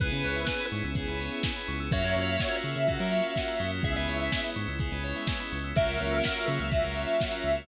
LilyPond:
<<
  \new Staff \with { instrumentName = "Lead 1 (square)" } { \time 4/4 \key cis \dorian \tempo 4 = 125 r1 | e''1 | r1 | e''1 | }
  \new Staff \with { instrumentName = "Ocarina" } { \time 4/4 \key cis \dorian b'4. r2 r8 | cis''4. r2 r8 | e''16 e''4~ e''16 r2 r8 | ais'4. r2 r8 | }
  \new Staff \with { instrumentName = "Electric Piano 2" } { \time 4/4 \key cis \dorian <b cis' e' gis'>4 <b cis' e' gis'>4 <b cis' e' gis'>4 <b cis' e' gis'>4 | <ais cis' eis' fis'>4 <ais cis' eis' fis'>4 <ais cis' eis' fis'>4 <ais cis' eis' fis'>8 <gis b cis' e'>8~ | <gis b cis' e'>4 <gis b cis' e'>4 <gis b cis' e'>4 <gis b cis' e'>4 | <fis ais cis' eis'>4 <fis ais cis' eis'>4 <fis ais cis' eis'>4 <fis ais cis' eis'>4 | }
  \new Staff \with { instrumentName = "Tubular Bells" } { \time 4/4 \key cis \dorian gis'16 b'16 cis''16 e''16 gis''16 b''16 cis'''16 e'''16 gis'16 b'16 cis''16 e''16 gis''16 b''16 cis'''16 e'''16 | fis'16 ais'16 cis''16 eis''16 fis''16 ais''16 cis'''16 eis'''16 fis'16 ais'16 cis''16 eis''16 fis''16 ais''16 cis'''16 eis'''16 | gis'16 b'16 cis''16 e''16 gis''16 b''16 cis'''16 e'''16 gis'16 b'16 cis''16 e''16 gis''16 b''16 cis'''16 e'''16 | fis'16 ais'16 cis''16 eis''16 fis''16 ais''16 cis'''16 eis'''16 fis'16 ais'16 cis''16 eis''16 fis''16 ais''16 cis'''16 eis'''16 | }
  \new Staff \with { instrumentName = "Synth Bass 1" } { \clef bass \time 4/4 \key cis \dorian cis,16 cis16 cis,4 gis,16 cis,8 cis,4~ cis,16 cis,8 | fis,16 fis,16 fis,4 cis16 cis8 fis4~ fis16 fis,8 | cis,16 cis,16 cis,4 gis,16 cis,8 cis,4~ cis,16 cis,8 | cis,16 cis,16 cis,4 cis16 cis,8 cis,4~ cis,16 cis,8 | }
  \new Staff \with { instrumentName = "String Ensemble 1" } { \time 4/4 \key cis \dorian <b cis' e' gis'>1 | <ais cis' eis' fis'>1 | <gis b cis' e'>1 | <fis ais cis' eis'>1 | }
  \new DrumStaff \with { instrumentName = "Drums" } \drummode { \time 4/4 <hh bd>16 hh16 hho16 hh16 <bd sn>16 hh16 hho16 hh16 <hh bd>16 hh16 hho16 hh16 <bd sn>16 hh16 hho16 hh16 | <hh bd>16 hh16 hho16 hh16 <bd sn>16 hh16 hho16 hh16 <hh bd>16 hh16 hho16 hh16 <bd sn>16 hh16 hho16 hh16 | <hh bd>16 hh16 hho16 hh16 <bd sn>16 hh16 hho16 hh16 <hh bd>16 hh16 hho16 hh16 <bd sn>16 hh16 hho16 hh16 | <hh bd>16 hh16 hho16 hh16 <bd sn>16 hh16 hho16 hh16 <hh bd>16 hh16 hho16 hh16 <bd sn>16 hh16 hho16 hh16 | }
>>